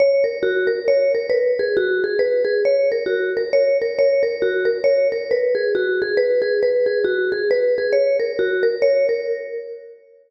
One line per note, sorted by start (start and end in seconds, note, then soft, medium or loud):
0.00 0.24 C#5 loud
0.24 0.41 A#4 medium
0.43 0.67 F#4 medium
0.67 0.84 A#4 medium
0.88 1.12 C#5 medium
1.15 1.31 A#4 medium
1.30 1.53 B4 medium
1.59 1.76 G#4 medium
1.77 2.01 F#4 loud
2.04 2.21 G#4 medium
2.19 2.43 B4 medium
2.45 2.61 G#4 medium
2.65 2.89 C#5 medium
2.92 3.08 A#4 medium
3.06 3.30 F#4 medium
3.37 3.54 A#4 medium
3.53 3.77 C#5 medium
3.82 3.98 A#4 medium
3.99 4.22 C#5 loud
4.23 4.40 A#4 medium
4.42 4.66 F#4 medium
4.65 4.82 A#4 medium
4.84 5.08 C#5 medium
5.12 5.29 A#4 medium
5.31 5.55 B4 medium
5.55 5.72 G#4 medium
5.75 5.99 F#4 medium
6.02 6.19 G#4 medium
6.17 6.41 B4 loud
6.42 6.59 G#4 medium
6.63 6.86 B4 medium
6.86 7.03 G#4 medium
7.04 7.28 F#4 medium
7.32 7.49 G#4 medium
7.51 7.75 B4 loud
7.78 7.95 G#4 medium
7.93 8.16 C#5 medium
8.19 8.36 A#4 medium
8.39 8.63 F#4 medium
8.63 8.80 A#4 medium
8.82 9.06 C#5 loud
9.09 9.26 A#4 medium